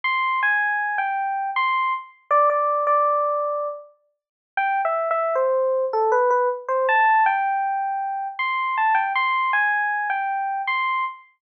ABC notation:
X:1
M:3/4
L:1/16
Q:1/4=79
K:C
V:1 name="Electric Piano 1"
c'2 _a3 g3 c'2 z2 | d d2 d5 z4 | (3g2 e2 e2 c3 A B B z c | a2 g6 c'2 a g |
c'2 _a3 g3 c'2 z2 |]